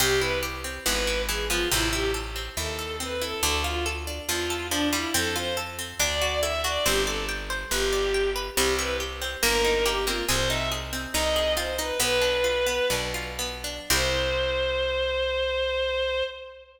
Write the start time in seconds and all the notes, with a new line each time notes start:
0.00 C2 C3 C4 G4
0.20 E4 B4
0.43 G4
0.64 C4
0.86 G#1 E3 B3 B4
1.07 E4
1.28 E3 G#4
1.50 F3 B3 F4
1.71 A1 C3 C4 E4
1.93 E4 G4
2.14 A4
2.36 C4
2.57 D#2 E4 A4
2.79 A4
3.00 C4 B4
3.22 E4 A4
3.43 D2 D3 D4 A4
3.64 F4
3.86 A4
4.07 D4
4.28 E2 F3 F4
4.50 A4
4.70 F3 D4
4.93 G3 E4 F4
5.14 F2 C4 A4
5.36 F4 C5
5.57 A4
5.79 C4
5.99 D2 D4 D5
6.22 F#4
6.42 E4 A4 E5
6.64 D4 F#4 D5
6.85 G1 C4 G4 C5
7.05 A4 D5
7.29 G5
7.50 C5
7.71 G1 G4 B4
7.93 D5
8.14 G5
8.36 B4
8.55 C2 G3 C4 G4
8.79 E4 B4
9.00 G4
9.22 C4
9.43 G1 A#3 A#4
9.65 D#4
9.86 A#3 G4
10.07 A#3 C4 F4
10.28 C2 C4 G#4 C5
10.49 D#4 E5
10.72 G#4
10.93 C4
11.14 C2 D#4 D#5
11.36 G#4
11.57 C4 F4 C5
11.78 D#4 B4
12.00 B1 B3 B4
12.21 D4
12.44 F4
12.67 B3
12.90 B1 D4
13.14 F4
13.39 B3
13.64 D4
13.90 C2 C4 E4 G4 C5